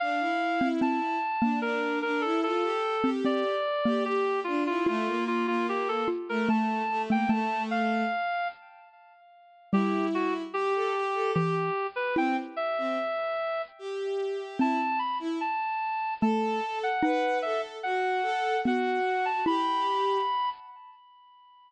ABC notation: X:1
M:3/4
L:1/16
Q:1/4=74
K:Dm
V:1 name="Clarinet"
f4 a4 B2 B A | A4 d4 G2 F F | F2 F F G A z B a3 g | a2 f4 z6 |
[K:Em] G2 F z G4 G3 B | g z e6 z4 | a2 b z a4 a3 f | f2 e z f4 f3 a |
b6 z6 |]
V:2 name="Violin"
D E2 E3 z D D2 D E | F G2 G3 z G G2 D E | A, B,2 B,3 z A, A,2 A, B, | A,4 z8 |
[K:Em] E4 G A G A G z3 | C z2 C z4 G4 | E z2 E z4 A4 | B2 A2 F2 A2 F4 |
G4 z8 |]
V:3 name="Xylophone"
z3 C C z2 B,5 | z3 C C z2 B,5 | F6 F2 A,3 A, | A,8 z4 |
[K:Em] G,8 E,2 z2 | E4 z8 | C8 A,2 z2 | ^D8 B,2 z2 |
E6 z6 |]